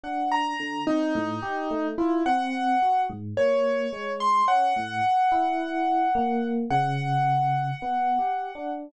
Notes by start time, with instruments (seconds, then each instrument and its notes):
0.03 electric piano 1 D4, acoustic grand piano F#5
0.31 acoustic grand piano A#5
0.59 electric piano 1 D3
0.87 electric piano 1 C4, acoustic grand piano D#4
1.15 electric piano 1 A2
1.42 electric piano 1 G4
1.70 electric piano 1 A3
1.98 acoustic grand piano E4, electric piano 1 F4
2.26 electric piano 1 C4, acoustic grand piano F#5
2.82 electric piano 1 F#4
3.09 electric piano 1 G#2
3.37 electric piano 1 A#3, acoustic grand piano C#5
3.93 electric piano 1 G#3
4.20 acoustic grand piano C6
4.48 electric piano 1 C#4, acoustic grand piano F#5
4.76 electric piano 1 A2
5.32 electric piano 1 E4
6.15 electric piano 1 A#3
6.70 electric piano 1 C#3, acoustic grand piano F#5
7.82 electric piano 1 B3
8.19 electric piano 1 G4
8.55 electric piano 1 D4